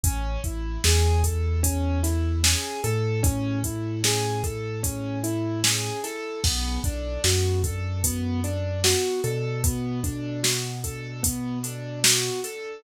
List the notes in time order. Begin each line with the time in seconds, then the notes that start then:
0.04 A1 C#4, kick, closed hi-hat
0.44 A1 E4, kick, closed hi-hat
0.84 E2 G#4, snare
1.24 A4, kick, closed hi-hat
1.63 C#4, kick, closed hi-hat
2.03 E4, snare, closed hi-hat
2.44 G#4, snare
2.84 A2 A4, closed hi-hat
3.23 C#4, kick, closed hi-hat
3.64 E4, kick, closed hi-hat
4.04 G#4, snare
4.44 A4, kick, closed hi-hat
4.83 C#4, kick, closed hi-hat
5.24 E4, closed hi-hat
5.64 G#4, snare
6.04 A4, snare, closed hi-hat
6.44 B1 B3, kick, crash
6.84 B1 D4, kick, closed hi-hat
7.24 F#2 F#4, snare
7.64 A4, kick, closed hi-hat
8.04 B3, kick, closed hi-hat
8.44 D4, closed hi-hat
8.84 F#4, snare
9.24 B2 A4, closed hi-hat
9.64 B3, kick, closed hi-hat
10.04 D4, kick, closed hi-hat
10.43 F#4, snare
10.84 A4, kick, closed hi-hat
11.23 B3, kick, closed hi-hat
11.63 D4, closed hi-hat
12.04 F#4, snare
12.44 A4, closed hi-hat